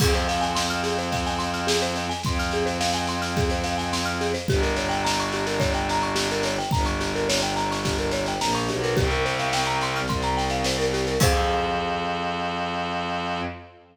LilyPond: <<
  \new Staff \with { instrumentName = "Marimba" } { \time 4/4 \key f \minor \tempo 4 = 107 aes'16 c''16 f''16 aes''16 c'''16 f'''16 aes'16 c''16 f''16 aes''16 c'''16 f'''16 aes'16 c''16 f''16 aes''16 | c'''16 f'''16 aes'16 c''16 f''16 aes''16 c'''16 f'''16 aes'16 c''16 f''16 aes''16 c'''16 f'''16 aes'16 c''16 | g'16 bes'16 des''16 g''16 bes''16 des'''16 g'16 bes'16 des''16 g''16 bes''16 des'''16 g'16 bes'16 des''16 g''16 | bes''16 des'''16 g'16 bes'16 des''16 g''16 bes''16 des'''16 g'16 bes'16 des''16 g''16 bes''16 des'''16 g'16 bes'16 |
g'16 bes'16 c''16 f''16 g''16 bes''16 c'''16 f'''16 c'''16 bes''16 g''16 f''16 c''16 bes'16 g'16 bes'16 | <aes' c'' f''>1 | }
  \new Staff \with { instrumentName = "Violin" } { \clef bass \time 4/4 \key f \minor f,1 | f,1 | g,,1 | g,,2. bes,,8 b,,8 |
c,2 c,2 | f,1 | }
  \new DrumStaff \with { instrumentName = "Drums" } \drummode { \time 4/4 <cymc bd sn>16 sn16 sn16 sn16 sn16 sn16 sn16 sn16 <bd sn>16 sn16 sn16 sn16 sn16 sn16 sn16 sn16 | <bd sn>16 sn16 sn16 sn16 sn16 sn16 sn16 sn16 <bd sn>16 sn16 sn16 sn16 sn16 sn16 sn16 sn16 | <bd sn>16 sn16 sn16 sn16 sn16 sn16 sn16 sn16 <bd sn>16 sn16 sn16 sn16 sn16 sn16 sn16 sn16 | <bd sn>16 sn16 sn16 sn16 sn16 sn16 sn16 sn16 <bd sn>16 sn16 sn16 sn16 sn16 sn16 sn16 sn16 |
<bd sn>16 sn16 sn16 sn16 sn16 sn16 sn16 sn16 <bd sn>16 sn16 sn16 sn16 sn16 sn16 sn16 sn16 | <cymc bd>4 r4 r4 r4 | }
>>